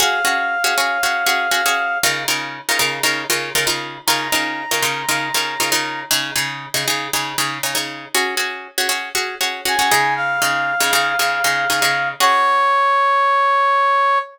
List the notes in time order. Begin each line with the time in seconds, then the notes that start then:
0.00 C#4 F#4 G#4 F5
0.25 C#4 F#4 G#4
0.64 C#4 F#4 G#4
0.78 C#4 F#4 G#4
1.03 C#4 F#4 G#4
1.26 C#4 F#4 G#4
1.51 C#4 F#4 G#4
1.66 C#4 F#4 G#4
2.03 C#3 D#4 F4 A#4
2.28 C#3 D#4 F4 A#4
2.69 C#3 D#4 F4 A#4
2.79 C#3 D#4 F4 A#4
3.03 C#3 D#4 F4 A#4
3.30 C#3 D#4 F4 A#4
3.55 C#3 D#4 F4 A#4
3.67 C#3 D#4 F4 A#4
4.07 C#3 D#4 F4 A#4 A#5
4.32 C#3 D#4 F4 A#4
4.71 C#3 D#4 F4 A#4
4.83 C#3 D#4 F4 A#4
5.09 C#3 D#4 F4 A#4
5.34 C#3 D#4 F4 A#4
5.60 C#3 D#4 F4 A#4
5.72 C#3 D#4 F4 A#4
6.11 C#3 D#4 G#4
6.36 C#3 D#4 G#4
6.74 C#3 D#4 G#4
6.88 C#3 D#4 G#4
7.13 C#3 D#4 G#4
7.38 C#3 D#4 G#4
7.63 C#3 D#4 G#4
7.75 C#3 D#4 G#4
8.15 C#4 F#4 G#4
8.37 C#4 F#4 G#4
8.78 C#4 F#4 G#4
8.89 C#4 F#4 G#4
9.15 C#4 F#4 G#4
9.41 C#4 F#4 G#4
9.65 C#4 F#4 G#4 G#5
9.79 C#4 F#4 G#4
9.91 C#3 D#4 G#4
10.16 F5
10.42 C#3 D#4 G#4
10.80 C#3 D#4 G#4
10.93 C#3 D#4 G#4
11.19 C#3 D#4 G#4
11.44 C#3 D#4 G#4
11.70 C#3 D#4 G#4
11.82 C#3 D#4 G#4
12.20 C#4 F#4 G#4 C#5